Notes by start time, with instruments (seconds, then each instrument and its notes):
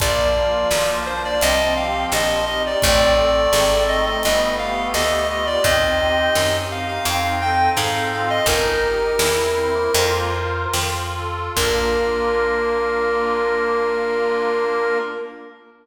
0.00 electric bass (finger) A#1, drawbar organ F3, accordion A#3, clarinet D5, kick, closed hi-hat
0.35 accordion F4
0.71 electric bass (finger) B1, accordion A#3, snare
1.06 accordion D4, clarinet C5
1.25 clarinet D5
1.41 electric bass (finger) C2, accordion C4, clarinet D#5, closed hi-hat
1.75 accordion G4, clarinet F5
2.11 electric bass (finger) A#1, accordion C4, clarinet D#5, snare
2.46 accordion D#4, clarinet D#5
2.66 clarinet D5
2.82 electric bass (finger) A1, drawbar organ A3, accordion C4, clarinet D5, kick, closed hi-hat
3.17 accordion A4
3.53 electric bass (finger) G#1, accordion C4, snare
3.88 accordion D#4, clarinet D#5
4.06 clarinet D#5
4.23 electric bass (finger) G1, accordion B3, clarinet D#5, closed hi-hat
4.59 accordion G4, clarinet F5
4.94 electric bass (finger) D2, accordion B3, clarinet D#5, snare
5.29 accordion F4, clarinet D#5
5.46 clarinet D5
5.64 electric bass (finger) D#2, accordion C4, drawbar organ D#4, clarinet D#5, kick, closed hi-hat
6.00 accordion G4
6.35 electric bass (finger) F#2, accordion C4, snare
6.71 accordion D#4, clarinet F5
6.88 clarinet F5
7.05 electric bass (finger) F2, accordion C4, clarinet F5, closed hi-hat
7.40 accordion A4, clarinet G5
7.76 electric bass (finger) G#2, accordion C4, clarinet F5, snare
8.11 accordion F4, clarinet F5
8.30 clarinet D#5
8.46 electric bass (finger) G1, accordion D#4, drawbar organ D#4, clarinet A#4, kick, closed hi-hat
8.81 accordion G4
9.19 electric bass (finger) E2, drawbar organ C4, accordion E4, snare
9.56 drawbar organ C4, accordion C5
9.75 drawbar organ A#3
9.94 electric bass (finger) F2, drawbar organ A#3, accordion F4 A#4 C5, closed hi-hat
10.73 electric bass (finger) F2, accordion F4, snare
11.15 accordion A4
11.56 electric bass (finger) A#1, drawbar organ A#3, accordion A#3 D4 F4, clarinet A#4, kick, crash